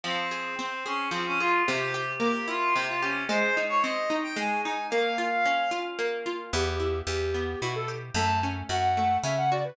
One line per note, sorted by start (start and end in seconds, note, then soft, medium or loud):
0.03 1.11 F3 loud
0.03 0.55 C4 loud
0.31 0.85 G#4 medium
0.59 1.61 C4 medium
0.59 0.84 C4 medium
0.85 1.08 C#4 medium
0.85 1.40 G#4 medium
1.11 1.63 F3 loud
1.11 1.25 C4 medium
1.26 1.39 C#4 medium
1.39 1.63 F4 medium
1.39 1.66 G#4 medium
1.67 2.75 C3 loud
1.67 2.11 G4 medium
1.94 3.02 G4 medium
2.20 3.22 A#3 medium
2.20 2.47 G4 medium
2.48 3.25 E4 medium
2.48 2.74 F4 loud
2.75 3.27 C3 medium
2.75 2.87 G4 medium
2.88 3.01 F4 medium
3.01 3.24 C#4 medium
3.01 3.28 G4 medium
3.29 4.36 G#3 loud
3.29 3.55 C5 loud
3.57 4.09 D#4 medium
3.69 3.82 C#5 loud
3.82 4.86 C4 medium
3.82 4.15 D#5 medium
4.10 4.65 D#4 medium
4.23 4.36 G5 medium
4.36 4.88 G#3 loud
4.36 4.61 G#5 medium
4.63 4.91 D#4 medium
4.63 4.86 G#5 medium
4.90 5.98 A#3 loud
4.90 5.78 F5 loud
5.18 5.71 F4 medium
5.45 6.48 C#4 medium
5.71 6.25 F4 medium
5.99 6.50 A#3 medium
6.26 6.52 F4 medium
6.53 7.02 E2 loud
6.53 7.34 B3 medium
6.53 6.99 G4 medium
6.80 7.62 E4 medium
7.07 7.55 E2 loud
7.07 7.88 G4 medium
7.07 7.59 G4 medium
7.34 8.11 B3 medium
7.61 8.11 B2 medium
7.61 8.14 E4 medium
7.61 7.74 F#4 medium
7.75 7.88 A4 medium
7.88 8.14 G4 medium
8.14 8.63 F#2 loud
8.14 8.97 A3 medium
8.14 8.39 A5 medium
8.43 9.24 C#4 medium
8.69 9.18 F#2 medium
8.69 9.51 F#4 medium
8.69 9.17 F#5 medium
8.97 9.74 A3 medium
9.23 9.72 C#3 medium
9.23 9.76 C#4 medium
9.23 9.36 E5 medium
9.37 9.50 F#5 medium
9.51 9.76 F#4 medium
9.51 9.64 D5 medium
9.64 9.76 B4 medium